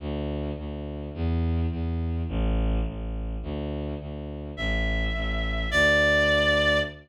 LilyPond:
<<
  \new Staff \with { instrumentName = "Clarinet" } { \time 6/8 \key d \major \tempo 4. = 105 r2. | r2. | r2. | r2. |
e''2. | d''2. | }
  \new Staff \with { instrumentName = "Violin" } { \clef bass \time 6/8 \key d \major d,4. d,4. | e,4. e,4. | a,,4. a,,4. | d,4. d,4. |
a,,4. a,,4. | d,2. | }
>>